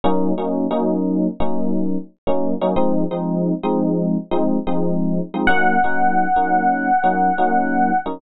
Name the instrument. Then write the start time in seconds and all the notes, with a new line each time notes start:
electric piano 1
0.04 F#3 A#3 C#4 D#4
0.38 F#3 A#3 C#4 D#4
0.71 F#3 A#3 C#4 D#4
1.40 F#3 A#3 C#4 D#4
2.27 F#3 A#3 C#4 D#4
2.62 F#3 A#3 C#4 D#4
2.76 F3 G#3 C4 D#4
3.11 F3 G#3 C4 D#4
3.63 F3 G#3 C4 D#4
4.31 F3 G#3 C4 D#4
4.67 F3 G#3 C4 D#4
5.34 F3 G#3 C4 D#4
5.47 F#3 A#3 C#4 D#4 F#5
5.84 F#3 A#3 C#4 D#4
6.36 F#3 A#3 C#4 D#4
7.04 F#3 A#3 C#4 D#4
7.38 F#3 A#3 C#4 D#4
8.06 F#3 A#3 C#4 D#4